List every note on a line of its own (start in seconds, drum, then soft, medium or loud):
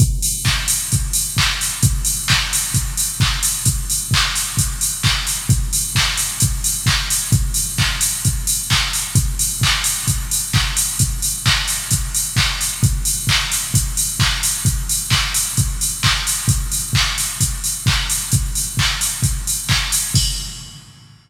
0.00 kick loud
0.00 closed hi-hat loud
0.22 open hi-hat loud
0.45 kick loud
0.45 clap loud
0.68 open hi-hat loud
0.92 kick loud
0.92 closed hi-hat loud
1.13 open hi-hat medium
1.37 kick medium
1.37 clap loud
1.61 open hi-hat medium
1.83 kick loud
1.83 closed hi-hat loud
2.05 open hi-hat loud
2.28 kick loud
2.28 clap loud
2.53 open hi-hat loud
2.74 kick loud
2.74 closed hi-hat loud
2.97 open hi-hat medium
3.20 kick loud
3.20 clap loud
3.43 open hi-hat loud
3.65 kick loud
3.65 closed hi-hat loud
3.90 open hi-hat medium
4.11 kick loud
4.11 clap loud
4.35 open hi-hat medium
4.57 kick medium
4.57 closed hi-hat loud
4.81 open hi-hat medium
5.03 kick loud
5.03 clap loud
5.27 open hi-hat medium
5.49 kick loud
5.49 closed hi-hat loud
5.73 open hi-hat loud
5.95 kick medium
5.95 clap loud
6.17 open hi-hat medium
6.40 kick loud
6.40 closed hi-hat loud
6.64 open hi-hat medium
6.86 kick loud
6.86 clap loud
7.10 open hi-hat loud
7.32 kick loud
7.32 closed hi-hat loud
7.54 open hi-hat loud
7.78 kick loud
7.78 clap loud
8.01 open hi-hat loud
8.25 kick loud
8.25 closed hi-hat loud
8.47 open hi-hat medium
8.70 kick medium
8.70 clap loud
8.93 open hi-hat medium
9.15 kick loud
9.15 closed hi-hat loud
9.39 open hi-hat loud
9.61 kick loud
9.61 clap loud
9.84 open hi-hat loud
10.08 kick loud
10.08 closed hi-hat loud
10.31 open hi-hat medium
10.53 kick loud
10.53 clap loud
10.77 open hi-hat loud
10.99 kick loud
10.99 closed hi-hat loud
11.22 open hi-hat medium
11.46 kick loud
11.46 clap loud
11.68 open hi-hat medium
11.91 kick medium
11.91 closed hi-hat loud
12.15 open hi-hat medium
12.36 kick loud
12.36 clap loud
12.61 open hi-hat medium
12.83 kick loud
12.83 closed hi-hat loud
13.05 open hi-hat loud
13.27 kick medium
13.27 clap loud
13.52 open hi-hat medium
13.74 kick loud
13.74 closed hi-hat loud
13.97 open hi-hat medium
14.19 kick loud
14.19 clap loud
14.43 open hi-hat loud
14.65 kick loud
14.65 closed hi-hat loud
14.89 open hi-hat medium
15.10 kick medium
15.10 clap loud
15.34 open hi-hat loud
15.57 kick loud
15.57 closed hi-hat loud
15.81 open hi-hat medium
16.03 kick medium
16.03 clap loud
16.27 open hi-hat medium
16.48 kick loud
16.48 closed hi-hat loud
16.72 open hi-hat medium
16.93 kick loud
16.93 clap loud
17.18 open hi-hat medium
17.41 kick medium
17.41 closed hi-hat loud
17.64 open hi-hat medium
17.86 kick loud
17.86 clap loud
18.10 open hi-hat medium
18.32 kick loud
18.32 closed hi-hat loud
18.55 open hi-hat medium
18.77 kick medium
18.77 clap loud
19.01 open hi-hat medium
19.23 kick loud
19.23 closed hi-hat loud
19.47 open hi-hat medium
19.69 kick medium
19.69 clap loud
19.92 open hi-hat loud
20.14 kick loud
20.14 crash loud